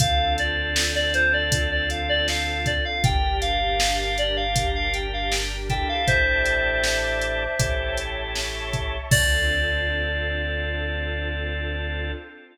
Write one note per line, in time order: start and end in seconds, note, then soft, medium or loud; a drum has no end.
0.00 2.79 D2 medium
0.00 2.73 C4 loud
0.00 3.01 C4 loud
0.00 2.73 D4 loud
0.00 3.01 D4 loud
0.00 2.73 F4 loud
0.00 3.01 F4 loud
0.00 2.73 A4 loud
0.00 3.01 A4 loud
0.00 0.33 F5 medium
0.00 kick medium
0.00 closed hi-hat loud
0.38 0.92 D5 medium
0.38 closed hi-hat medium
0.76 snare loud
0.95 1.13 D5 medium
1.14 1.32 C5 medium
1.14 closed hi-hat medium
1.33 1.70 D5 medium
1.52 kick medium
1.52 closed hi-hat loud
1.71 1.89 D5 medium
1.90 2.08 F5 medium
1.90 closed hi-hat medium
2.09 2.27 D5 medium
2.28 2.65 F5 medium
2.28 snare medium
2.66 2.84 D5 medium
2.66 kick medium
2.66 closed hi-hat medium
2.85 3.03 F5 medium
3.03 5.83 G1 loud
3.03 6.04 D4 loud
3.03 5.56 D4 loud
3.03 6.04 G4 loud
3.03 5.56 G4 loud
3.03 6.04 A#4 medium
3.03 5.56 A#4 loud
3.03 3.37 G5 medium
3.03 kick loud
3.03 closed hi-hat medium
3.41 3.96 F5 medium
3.41 closed hi-hat medium
3.80 snare loud
3.99 4.17 F5 medium
4.18 4.36 D5 medium
4.18 closed hi-hat medium
4.37 4.68 F5 medium
4.56 kick medium
4.56 closed hi-hat loud
4.75 4.93 F5 medium
4.94 5.12 G5 medium
4.94 closed hi-hat medium
5.13 5.31 F5 medium
5.31 5.63 G5 medium
5.31 snare medium
5.70 7.44 D4 loud
5.70 7.44 E4 loud
5.70 7.44 G4 loud
5.70 7.44 A4 loud
5.70 5.88 G5 medium
5.70 kick medium
5.70 closed hi-hat medium
5.88 6.06 F5 medium
6.07 7.47 A1 loud
6.07 7.98 C5 medium
6.07 6.83 D5 loud
6.07 7.98 E5 medium
6.07 6.83 E5 loud
6.07 6.83 G5 loud
6.07 6.83 A5 loud
6.07 kick medium
6.07 closed hi-hat medium
6.46 closed hi-hat medium
6.84 7.59 D5 medium
6.84 7.59 E5 medium
6.84 7.59 A5 medium
6.84 7.59 D6 loud
6.84 snare loud
7.22 closed hi-hat medium
7.59 8.99 A1 medium
7.59 8.97 C#4 loud
7.59 8.97 E4 loud
7.59 8.97 G4 loud
7.59 8.97 A4 loud
7.59 8.35 C#5 loud
7.59 8.35 E5 loud
7.59 8.35 G5 loud
7.59 8.35 A5 loud
7.59 kick medium
7.59 closed hi-hat loud
7.97 closed hi-hat medium
8.35 9.10 C#5 loud
8.35 9.10 E5 loud
8.35 9.10 A5 medium
8.35 9.10 C#6 medium
8.35 snare medium
8.73 kick medium
8.73 closed hi-hat medium
9.11 12.11 D2 loud
9.11 12.12 C4 loud
9.11 12.12 D4 medium
9.11 12.12 D4 loud
9.11 12.12 F4 loud
9.11 12.12 A4 loud
9.11 12.12 D5 loud
9.11 kick loud
9.11 crash loud